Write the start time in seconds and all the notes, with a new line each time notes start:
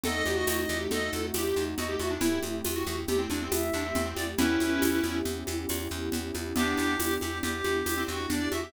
0.03 E2 A3 C4 D#4 F#4 A4 D#5, low conga, shaker
0.25 E2 G4, high conga, shaker
0.36 F#4
0.47 E2 D#5, tambourine, high conga, shaker
0.69 E2 G4, high conga, shaker
0.91 E2 A4 D#5, low conga, shaker
1.13 E2, high conga, shaker
1.34 E2 G4, tambourine, high conga, shaker
1.56 E2, shaker
1.78 E2 F#4 D#5, low conga, shaker
1.88 G4
1.99 E2 F#4 E5, high conga, shaker
2.10 D4
2.21 E2 A3 C4 E4 G4 E5, low conga, shaker
2.43 E2, high conga, shaker
2.64 E2, tambourine, high conga, shaker
2.75 F#4
2.87 E2, high conga, shaker
3.08 E2 G4, low conga, shaker
3.18 C4
3.30 E2 D4, high conga, shaker
3.41 C4
3.52 E2 E5, tambourine, high conga, shaker
3.73 E2 D4, shaker
3.85 C4
3.95 E2 C4, low conga, shaker
4.05 C4
4.16 E2 D5, high conga, shaker
4.38 E2 B3 C#4 E4 G4 B4, low conga, shaker
4.60 E2, high conga, shaker
4.82 E2, tambourine, high conga, shaker
5.03 E2, high conga, shaker
5.25 E2, low conga, shaker
5.47 E2, high conga, shaker
5.69 E2, tambourine, high conga, shaker
5.90 E2, shaker
6.12 E2, low conga, shaker
6.34 E2, high conga, shaker
6.56 E2 B3 D4 E4 G4, low conga, shaker
6.78 E2, high conga, shaker
7.00 E2, tambourine, high conga, shaker
7.20 E2 G4, high conga, shaker
7.42 E2 G4, low conga, shaker
7.64 E2, high conga, shaker
7.86 E2, tambourine, high conga, shaker
7.97 C4
8.07 E2 C4 F#4, shaker
8.30 E2 D4 D5, low conga, shaker
8.51 E2 F#4 E5, high conga, shaker
8.63 G4